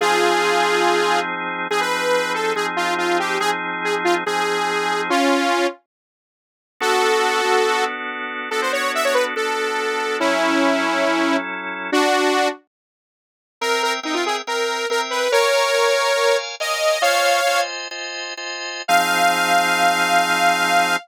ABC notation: X:1
M:4/4
L:1/16
Q:1/4=141
K:Fm
V:1 name="Lead 2 (sawtooth)"
[FA]12 z4 | A =B5 =A2 _A z F2 F2 G2 | A z3 A z F z A8 | [DF]6 z10 |
[K:F#m] [FA]12 z4 | A ^B c2 e c =B z A8 | [CE]12 z4 | [DF]6 z10 |
[K:Fm] B2 B z E F A z B4 B z =B2 | [Bd]12 e4 | "^rit." [df]6 z10 | f16 |]
V:2 name="Drawbar Organ"
[F,CEA]8 [F,CEA]8 | [F,CEA]8 [F,CEA]8 | [F,CEA]8 [F,CEA]8 | z16 |
[K:F#m] [B,DFA]6 [B,DFA]10 | [B,DFA]8 [B,DFA]8 | [F,CEA]8 [F,CEA]8 | z16 |
[K:Fm] [CB=eg]4 [CBeg]4 [CBeg]4 [CBeg]4 | [Bdfa]4 [Bdfa]4 [Bdfa]4 [Bdfa]4 | "^rit." [Fcea]4 [Fcea]4 [Fcea]4 [Fcea]4 | [F,CEA]16 |]